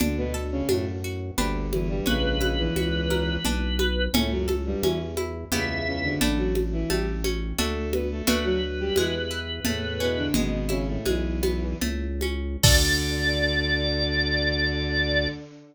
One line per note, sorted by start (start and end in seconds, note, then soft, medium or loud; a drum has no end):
0.00 0.62 D2 loud
0.00 0.16 D3 medium
0.00 0.16 D4 medium
0.00 0.69 D4 medium
0.00 low conga loud
0.17 0.34 B2 medium
0.17 0.34 B3 medium
0.34 1.32 A4 medium
0.52 0.68 C#3 medium
0.52 0.68 C#4 medium
0.69 1.31 F#2 loud
0.69 0.85 A2 medium
0.69 0.85 A3 medium
0.69 1.35 D4 medium
0.69 high conga medium
1.04 1.37 F#4 medium
1.37 2.01 G1 loud
1.37 1.66 D2 medium
1.37 1.66 D3 medium
1.37 2.00 D4 medium
1.37 2.00 G4 medium
1.37 2.00 B4 medium
1.37 low conga medium
1.72 1.88 E2 medium
1.72 1.88 E3 medium
1.72 high conga medium
1.89 2.05 G2 medium
1.89 2.05 G3 medium
2.06 2.69 A#1 loud
2.06 2.40 C#2 medium
2.06 2.40 C#3 medium
2.06 3.37 C#4 medium
2.06 4.05 B4 medium
2.06 low conga medium
2.41 2.58 C#2 medium
2.41 2.58 C#3 medium
2.41 3.39 E4 medium
2.41 high conga medium
2.58 3.35 E2 medium
2.58 3.35 E3 medium
2.76 3.38 C#2 loud
2.76 3.42 F#4 medium
2.76 high conga medium
3.10 3.43 A#4 medium
3.10 high conga medium
3.45 4.08 B1 loud
3.45 4.11 D4 medium
3.45 low conga medium
3.79 4.12 B4 medium
3.79 high conga medium
4.13 4.75 C#2 loud
4.13 4.30 A2 medium
4.13 4.30 A3 medium
4.13 4.83 C#4 medium
4.13 low conga loud
4.31 4.47 F#2 medium
4.31 4.47 F#3 medium
4.48 5.46 A4 medium
4.48 high conga medium
4.66 4.82 G2 medium
4.66 4.82 G3 medium
4.82 4.98 E2 medium
4.82 5.45 E2 loud
4.82 4.98 E3 medium
4.82 5.49 C#4 medium
4.82 high conga medium
5.17 5.50 E4 medium
5.17 high conga medium
5.52 5.81 C#2 medium
5.52 6.15 E2 loud
5.52 5.81 C#3 medium
5.52 6.14 B3 medium
5.52 6.14 E4 medium
5.52 6.14 G4 medium
5.52 6.14 E5 medium
5.52 low conga medium
5.86 6.03 C#2 medium
5.86 6.03 C#3 medium
6.03 6.20 D2 medium
6.03 6.20 D3 medium
6.21 6.84 A1 loud
6.21 6.37 D3 medium
6.21 6.83 A3 medium
6.21 6.83 D4 medium
6.21 6.37 D4 medium
6.21 6.83 E4 medium
6.21 low conga medium
6.38 6.54 F#3 medium
6.38 6.54 F#4 medium
6.55 high conga medium
6.72 6.89 E3 medium
6.72 6.89 E4 medium
6.90 7.53 A1 loud
6.90 7.06 G3 medium
6.90 7.55 A3 medium
6.90 7.06 G4 medium
6.90 high conga medium
7.24 7.57 C#4 medium
7.24 high conga medium
7.58 8.22 D2 loud
7.58 7.88 A3 medium
7.58 8.21 A3 medium
7.58 8.21 D4 medium
7.58 8.21 F#4 medium
7.58 7.88 A4 medium
7.58 low conga medium
7.92 8.09 B3 medium
7.92 8.09 B4 medium
7.92 high conga medium
8.11 8.27 A3 medium
8.11 8.27 A4 medium
8.27 8.91 D2 loud
8.27 8.89 A3 medium
8.27 8.44 A3 medium
8.27 8.89 D4 medium
8.27 8.89 F#4 medium
8.27 8.44 A4 medium
8.27 10.26 B4 medium
8.27 low conga loud
8.44 8.61 F#3 medium
8.44 8.61 F#4 medium
8.80 8.96 G3 medium
8.80 8.96 G4 medium
8.96 9.60 E2 loud
8.96 9.14 E3 medium
8.96 9.63 G#3 medium
8.96 9.14 E4 medium
8.96 high conga medium
9.31 9.64 E4 medium
9.65 10.29 E2 loud
9.65 9.98 A2 medium
9.65 10.31 A3 medium
9.65 9.98 A3 medium
9.65 low conga medium
10.00 10.17 B2 medium
10.00 10.17 B3 medium
10.00 10.33 C#4 medium
10.17 10.33 D3 medium
10.17 10.33 D4 medium
10.34 10.98 G#1 loud
10.34 10.64 B2 medium
10.34 11.05 G#3 medium
10.34 10.64 B3 medium
10.34 low conga loud
10.69 10.86 C#3 medium
10.69 10.86 C#4 medium
10.69 11.75 E4 medium
10.69 high conga medium
10.88 11.05 A2 medium
10.88 11.05 A3 medium
11.05 11.74 B1 medium
11.05 11.73 E2 medium
11.05 11.73 E3 medium
11.05 11.78 G#3 medium
11.05 high conga medium
11.43 11.80 B3 medium
11.43 high conga medium
11.81 12.57 C#2 loud
11.81 12.59 A3 medium
11.81 low conga medium
12.21 12.62 C#4 medium
12.21 high conga medium
12.63 15.28 D2 loud
12.63 15.27 D3 loud
12.63 15.28 D4 loud
12.63 15.28 F#4 medium
12.63 15.28 A4 loud
12.63 15.28 D5 loud
12.63 kick loud
12.63 crash loud